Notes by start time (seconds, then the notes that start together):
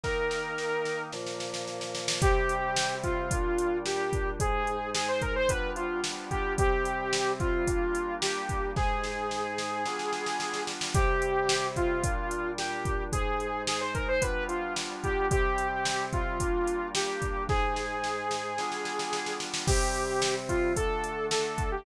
0.04 D#3 A#3 D#4 A#4, kick, snare
0.31 snare
0.58 snare
0.85 snare
1.13 A#2 F3 A#3, snare
1.26 snare
1.40 snare
1.54 snare
1.68 snare
1.81 snare
1.95 snare
2.08 snare
2.22 C3 G3 C4 G4, kick, closed hi-hat
2.49 closed hi-hat
2.76 snare
3.03 F4, kick, closed hi-hat
3.31 A#2 G3 D4, kick, closed hi-hat
3.58 closed hi-hat
3.86 G4, snare
4.13 kick, closed hi-hat
4.40 G#2 G#3 D#4 G#4, kick, closed hi-hat
4.67 closed hi-hat
4.95 G#4, snare
5.08 C5
5.22 A#4, kick, closed hi-hat
5.36 C5
5.49 G3 B3 D4 F4 B4, kick, closed hi-hat
5.76 F4, closed hi-hat
6.04 snare
6.31 G4, kick, closed hi-hat
6.58 C3 G3 C4 G4, kick, closed hi-hat
6.85 closed hi-hat
7.13 snare
7.40 F4, kick, closed hi-hat
7.67 G3 A#3 D4, kick, closed hi-hat
7.95 closed hi-hat
8.22 G4, snare
8.49 kick, closed hi-hat
8.76 G#2 G#3 D#4 G#4, kick, snare
9.04 snare
9.31 snare
9.58 snare
9.85 G3 B3 D4 F4, snare
9.99 snare
10.13 snare
10.26 snare
10.40 snare
10.54 snare
10.67 snare
10.81 snare
10.94 C3 G3 C4 G4, kick, closed hi-hat
11.22 closed hi-hat
11.49 snare
11.76 F4, kick, closed hi-hat
12.03 A#2 G3 D4, kick, closed hi-hat
12.31 closed hi-hat
12.58 G4, snare
12.85 kick, closed hi-hat
13.12 G#2 G#3 D#4 G#4, kick, closed hi-hat
13.40 closed hi-hat
13.67 G#4, snare
13.81 C5
13.95 A#4, kick, closed hi-hat
14.08 C5
14.22 G3 B3 D4 F4 B4, kick, closed hi-hat
14.49 F4, closed hi-hat
14.76 snare
15.04 G4, kick, closed hi-hat
15.31 C3 G3 C4 G4, kick, closed hi-hat
15.58 closed hi-hat
15.85 snare
16.13 F4, kick, closed hi-hat
16.40 G3 A#3 D4, kick, closed hi-hat
16.67 closed hi-hat
16.95 G4, snare
17.22 kick, closed hi-hat
17.49 G#2 G#3 D#4 G#4, kick, snare
17.76 snare
18.04 snare
18.31 snare
18.58 G3 B3 D4 F4, snare
18.72 snare
18.85 snare
18.99 snare
19.13 snare
19.26 snare
19.40 snare
19.54 snare
19.67 C3 G3 C4 G4, kick, crash
19.95 closed hi-hat
20.22 snare
20.49 F4, kick, closed hi-hat
20.76 D3 A3 D4 A4, kick, closed hi-hat
21.04 closed hi-hat
21.31 A4, snare
21.58 kick, closed hi-hat
21.72 G4